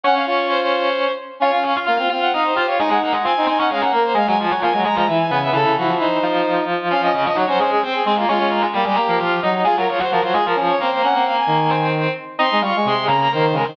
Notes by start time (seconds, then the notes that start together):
0.04 C#4 C#5 F#5
0.15 C#4 F5
0.26 F4 C#5
0.49 C5
0.61 C5
1.40 C#4 F4 C#5 F5
1.52 C#4 F5
1.63 C#4 C#5 F5
1.76 F4 F5
1.85 A#3 F4 F5
1.97 C4 F4 F5
2.09 C4 F4 F5
2.21 C4 F#5
2.33 D#4 D#5 F5
2.44 C5
2.54 F4 G4 C5 F5
2.67 F4 C#5 F5
2.78 G#3 D#4 G#4 D#5
2.89 G#3 D#4 G#4 F#5
3.01 A#3 A#4 F#5
3.12 G#3 G#4
3.23 C4 F4 C5 G#5
3.37 D#4
3.46 C4 D#4 C5 G#5
3.58 C#4 D#4 C#5 F#5
3.69 G#3 C#4 G#4 F5
3.81 A#3 A#4 F#5
3.93 A#3 A#4
4.04 C5
4.14 G#3 G#4 F5
4.27 F#3 G#3 F#4 G#5
4.39 F3 F4 G#5
4.51 F#3 F#4
4.62 F3 A#3 F4 G#5
4.72 F#3 G#3 F#4
4.84 G#3 G#4 A#5
4.95 F3 G#3 F4 A#5
5.07 E3 E4 E5
5.19 G#5
5.30 C#3 B3 B4 G#5
5.42 E5
5.53 C#3 E3 E4 A4
5.66 C#3
5.76 F3 F#4
5.87 F3
5.99 D#4 C5
6.23 F3 F4
6.90 F3 C#4 F4 F5
7.02 C#4 D#5
7.13 C#3 C#4 D#5
7.25 F3 F4 D#5
7.34 F#3 D#4 F#4 C#5
7.47 F#3 C#4 F#4 C5
7.59 G#3 C#4 G#4 C5
7.71 C#4 G#4
7.82 C4 C5
7.94 G#4
8.05 G#3 C4 G#4 C5
8.16 A#3 F4 A#4
8.28 G#3 C#4 F4 C#5
8.39 G#3
8.50 A#3 A#4
8.62 G#3 G#4
8.74 G3 A#3 G4
8.84 G3 G#3 G4 G#4
8.96 A#3 A#4
9.08 F3 A#3 A#4
9.19 F3 F4 F5
9.43 F#3 D#4 D#5
9.64 G#3 F4 G#4
9.77 F#3 F4 F#4 A#4
9.88 F3 F4 C#5
9.99 F#3 F#4 C5
10.10 F3 F4 F#4 A#4
10.21 F#3 F4 F#4 C5
10.32 G#3 F4 G#4
10.45 F3 F4 A#4
10.55 F3 C#4 F4
10.68 C#5
10.80 A#3 C4 A#4 C5
10.91 C5
11.03 A#3 C#4 A#4 F#5
11.15 C4
11.26 F5
11.37 G#5
11.47 D#3
11.70 C4 C5
12.39 C4 D#4 D#5 C6
12.52 G#3
12.61 G3 F4 F5 C#6
12.76 G#3
12.85 C3 G#3 G#4 C6
13.06 C#3 A#3 A#4 A#5
13.20 A#5
13.32 D#3 A#3 A#4 C5
13.53 C#3 G#3 G#4 A#4
13.64 D#3 C4 C5